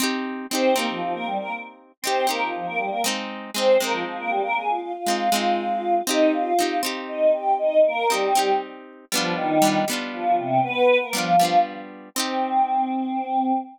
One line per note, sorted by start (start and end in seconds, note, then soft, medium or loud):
0.00 0.47 C4 loud
0.00 0.47 D#4 medium
0.00 0.47 G4 loud
0.50 0.74 C4 medium
0.50 0.74 D#4 medium
0.50 0.74 C5 loud
0.55 0.74 G4 loud
0.74 0.86 A#3 medium
0.74 1.92 C4 medium
0.74 1.92 D#4 medium
0.74 0.86 A#4 loud
0.79 1.92 G4 medium
0.89 1.01 F3 medium
0.89 1.01 F4 loud
1.01 1.13 F3 medium
1.01 1.13 F4 loud
1.14 1.26 A#3 medium
1.14 1.26 A#4 loud
1.26 1.38 G3 medium
1.26 1.38 G4 loud
1.39 1.51 A#3 medium
1.39 1.51 A#4 loud
2.02 2.25 C4 medium
2.02 2.26 C4 medium
2.02 2.27 D#4 medium
2.02 2.25 C5 medium
2.07 2.27 G4 loud
2.27 2.41 A#3 medium
2.27 2.97 C4 medium
2.27 2.97 D#4 medium
2.27 2.97 G4 medium
2.27 2.41 A#4 loud
2.42 2.53 F3 medium
2.42 2.53 F4 medium
2.54 2.66 F3 medium
2.54 2.66 F4 medium
2.66 2.78 A#3 medium
2.66 2.78 A#4 medium
2.78 2.90 G3 medium
2.78 2.90 G4 loud
2.90 3.02 A#3 medium
2.90 3.02 A#4 medium
3.04 3.51 G#3 medium
3.04 3.51 C4 loud
3.04 3.51 D#4 loud
3.54 3.78 G#3 medium
3.54 3.77 C4 loud
3.54 3.78 C4 medium
3.54 3.78 D#4 medium
3.54 3.77 C5 loud
3.80 4.97 G#3 medium
3.80 3.92 A#3 medium
3.80 4.97 C4 medium
3.80 3.92 A#4 medium
3.84 4.97 D#4 medium
3.91 4.03 F3 medium
3.91 4.03 F4 loud
4.05 4.17 F3 medium
4.05 4.17 F4 loud
4.18 4.30 A#3 medium
4.18 4.30 A#4 medium
4.30 4.42 G3 loud
4.30 4.42 G4 loud
4.43 4.55 A#3 medium
4.43 4.55 A#4 loud
4.56 4.68 G#4 loud
4.56 4.68 G#5 loud
4.68 4.80 F4 medium
4.68 4.80 F5 loud
4.80 4.92 F4 loud
4.80 4.92 F5 loud
4.94 5.95 F4 medium
4.94 5.95 F5 loud
5.06 5.30 G#3 medium
5.06 5.30 C4 medium
5.06 5.30 D#4 medium
5.32 6.02 G#3 medium
5.32 6.02 C4 medium
5.32 6.02 D#4 medium
6.07 6.54 C4 loud
6.07 6.31 D#4 loud
6.07 6.54 D#4 loud
6.07 6.54 G4 loud
6.07 6.31 D#5 loud
6.34 6.76 F4 medium
6.34 6.76 F5 loud
6.59 6.82 C4 medium
6.59 6.82 D#4 medium
6.59 6.82 G4 medium
6.83 7.99 C4 medium
6.83 7.99 D#4 medium
6.83 7.99 G4 loud
7.08 7.31 D#4 medium
7.08 7.31 D#5 loud
7.33 7.54 G4 medium
7.33 7.54 G5 medium
7.59 7.80 D#4 loud
7.59 7.80 D#5 loud
7.86 8.07 A#3 loud
7.86 8.07 A#4 loud
8.09 8.50 G3 loud
8.09 8.33 C4 medium
8.09 8.33 D#4 medium
8.09 8.50 G4 loud
8.14 8.33 G4 medium
8.35 9.05 C4 medium
8.35 9.05 D#4 medium
8.35 9.05 G4 medium
9.12 9.34 F3 medium
9.12 9.59 G3 loud
9.12 9.59 B3 loud
9.12 9.59 D4 loud
9.12 9.34 F4 loud
9.17 9.59 F4 medium
9.35 9.78 D#3 loud
9.35 9.78 D#4 loud
9.62 9.85 G3 loud
9.62 9.85 B3 medium
9.62 9.85 D4 medium
9.67 9.85 F4 medium
9.88 11.04 G3 medium
9.88 11.04 B3 medium
9.88 11.04 D4 medium
9.93 11.04 F4 medium
10.13 10.35 F3 medium
10.13 10.35 F4 loud
10.38 10.60 C3 medium
10.38 10.60 C4 loud
10.64 10.98 B3 loud
10.64 10.98 B4 loud
11.02 11.14 A#3 medium
11.02 11.14 A#4 medium
11.13 11.59 F3 medium
11.13 11.36 G3 medium
11.13 11.36 B3 medium
11.13 11.36 D4 medium
11.13 11.59 F4 loud
11.18 11.36 F4 medium
11.39 12.09 G3 medium
11.39 12.09 B3 medium
11.39 12.09 D4 medium
11.45 12.09 F4 medium
12.15 13.52 C4 loud
12.15 13.53 C4 loud
12.15 13.53 D#4 medium
12.20 13.53 G4 loud